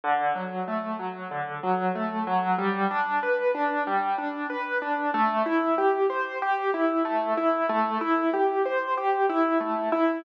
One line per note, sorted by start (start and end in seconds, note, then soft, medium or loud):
0.04 0.33 D3 loud
0.35 0.64 F#3 medium
0.68 0.96 A3 medium
0.99 1.28 F#3 medium
1.31 1.60 D3 medium
1.63 1.92 F#3 medium
1.95 2.24 A3 medium
2.27 2.56 F#3 loud
2.58 2.87 G3 loud
2.91 3.20 D4 medium
3.23 3.52 B4 medium
3.55 3.83 D4 medium
3.87 4.16 G3 loud
4.18 4.47 D4 medium
4.50 4.78 B4 medium
4.82 5.11 D4 medium
5.14 5.43 A3 loud
5.46 5.75 E4 medium
5.78 6.07 G4 medium
6.10 6.38 C5 medium
6.42 6.71 G4 loud
6.74 7.03 E4 medium
7.05 7.34 A3 medium
7.37 7.66 E4 medium
7.69 7.98 A3 loud
8.01 8.30 E4 medium
8.34 8.62 G4 medium
8.65 8.94 C5 medium
8.97 9.26 G4 medium
9.29 9.58 E4 loud
9.60 9.89 A3 medium
9.92 10.21 E4 loud